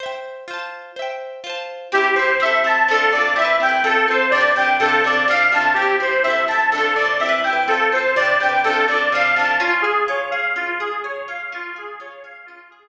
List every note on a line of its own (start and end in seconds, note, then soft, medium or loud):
0.00 0.44 C5 medium
0.00 0.44 E5 medium
0.06 0.44 G5 medium
0.48 0.92 F4 medium
0.48 0.92 C5 medium
0.54 0.92 A5 medium
0.96 1.40 C5 medium
0.96 1.40 E5 medium
1.02 1.40 G5 medium
1.44 1.88 F4 medium
1.44 1.88 C5 medium
1.50 1.88 A5 medium
1.92 2.14 C4 medium
1.92 2.14 E4 medium
1.92 2.15 G4 medium
1.98 2.14 G4 medium
2.15 2.38 C4 medium
2.15 2.38 E4 medium
2.15 2.37 C5 medium
2.22 2.38 G4 medium
2.40 2.62 C4 medium
2.40 2.62 E4 medium
2.40 2.63 E5 medium
2.46 2.62 A4 medium
2.64 2.86 C4 medium
2.64 2.86 E4 medium
2.64 2.88 A5 medium
2.70 2.86 A4 medium
2.88 3.10 C3 medium
2.88 3.10 D4 medium
2.88 3.12 A4 medium
2.94 3.10 F4 medium
2.94 3.10 A4 medium
3.12 3.34 C3 medium
3.12 3.34 D4 medium
3.12 3.35 D5 medium
3.18 3.34 F4 medium
3.18 3.34 A4 medium
3.36 3.58 C4 medium
3.36 3.58 E4 medium
3.36 3.59 E5 medium
3.42 3.58 G4 medium
3.42 3.58 B4 medium
3.60 3.82 C4 medium
3.60 3.82 E4 medium
3.60 3.83 G5 medium
3.66 3.82 G4 medium
3.66 3.82 B4 medium
3.84 4.06 C4 medium
3.84 4.06 F4 medium
3.84 4.06 A4 medium
3.90 4.06 A4 medium
4.08 4.30 C4 medium
4.08 4.30 F4 medium
4.08 4.31 C5 medium
4.14 4.30 A4 medium
4.31 4.54 C3 medium
4.31 4.53 D5 medium
4.35 4.54 D4 medium
4.35 4.54 G4 medium
4.41 4.54 B4 medium
4.56 4.78 C3 medium
4.56 4.78 D4 medium
4.56 4.78 G5 medium
4.62 4.78 G4 medium
4.62 4.78 B4 medium
4.80 5.02 C3 medium
4.80 5.02 D4 medium
4.80 5.02 A4 medium
4.86 5.02 F4 medium
4.86 5.02 A4 medium
5.04 5.26 C3 medium
5.04 5.26 D4 medium
5.04 5.28 D5 medium
5.10 5.26 F4 medium
5.10 5.26 A4 medium
5.28 5.50 C3 medium
5.28 5.50 D4 medium
5.28 5.51 F5 medium
5.34 5.50 F4 medium
5.34 5.50 A4 medium
5.52 5.74 C3 medium
5.52 5.74 D4 medium
5.52 5.75 A5 medium
5.58 5.74 F4 medium
5.58 5.74 A4 medium
5.74 5.98 C4 medium
5.74 5.96 G4 medium
5.79 5.98 E4 medium
5.79 5.98 G4 medium
6.00 6.22 C4 medium
6.00 6.22 E4 medium
6.00 6.23 C5 medium
6.06 6.22 G4 medium
6.23 6.46 C4 medium
6.23 6.46 E4 medium
6.23 6.45 E5 medium
6.30 6.46 A4 medium
6.48 6.70 C4 medium
6.48 6.70 E4 medium
6.48 6.70 A5 medium
6.54 6.70 A4 medium
6.72 6.94 C3 medium
6.72 6.94 D4 medium
6.72 6.94 A4 medium
6.78 6.94 F4 medium
6.78 6.94 A4 medium
6.95 7.18 C3 medium
6.95 7.18 D4 medium
6.95 7.17 D5 medium
7.02 7.18 F4 medium
7.02 7.18 A4 medium
7.20 7.42 C4 medium
7.20 7.42 E4 medium
7.20 7.42 E5 medium
7.26 7.42 G4 medium
7.26 7.42 B4 medium
7.44 7.66 C4 medium
7.44 7.66 E4 medium
7.44 7.66 G5 medium
7.50 7.66 G4 medium
7.50 7.66 B4 medium
7.68 7.90 C4 medium
7.68 7.90 F4 medium
7.68 7.90 A4 medium
7.74 7.90 A4 medium
7.92 8.14 C4 medium
7.92 8.14 F4 medium
7.92 8.15 C5 medium
7.98 8.14 A4 medium
8.16 8.38 C3 medium
8.16 8.38 D4 medium
8.16 8.38 D5 medium
8.22 8.38 G4 medium
8.22 8.38 B4 medium
8.40 8.62 C3 medium
8.40 8.62 D4 medium
8.40 8.62 G5 medium
8.46 8.62 G4 medium
8.46 8.62 B4 medium
8.64 8.86 C3 medium
8.64 8.86 D4 medium
8.64 8.86 A4 medium
8.70 8.86 F4 medium
8.70 8.86 A4 medium
8.88 9.10 C3 medium
8.88 9.10 D4 medium
8.88 9.10 D5 medium
8.94 9.10 F4 medium
8.94 9.10 A4 medium
9.12 9.34 C3 medium
9.12 9.34 D4 medium
9.12 9.35 F5 medium
9.18 9.34 F4 medium
9.18 9.34 A4 medium
9.35 9.58 C3 medium
9.35 9.58 D4 medium
9.35 9.57 A5 medium
9.42 9.58 F4 medium
9.42 9.58 A4 medium
9.60 10.55 C#4 loud
9.60 9.82 F4 medium
9.82 10.04 G#4 medium
9.82 10.32 G#4 medium
10.08 11.28 F4 medium
10.08 10.30 C#5 medium
10.31 10.80 G#4 medium
10.31 10.53 F5 medium
10.56 11.47 C#4 medium
10.56 10.78 F4 medium
10.80 11.02 G#4 medium
10.80 11.04 G#4 medium
11.04 11.50 G#4 medium
11.04 11.26 C#5 medium
11.28 11.51 F4 medium
11.28 11.50 F5 medium
11.52 12.48 C#4 loud
11.52 11.75 F4 medium
11.76 12.23 G#4 medium
11.76 12.00 G#4 medium
12.00 12.88 F4 medium
12.00 12.23 C#5 medium
12.24 12.71 G#4 medium
12.24 12.46 F5 medium
12.46 12.88 C#4 medium
12.46 12.68 F4 medium
12.70 12.88 G#4 medium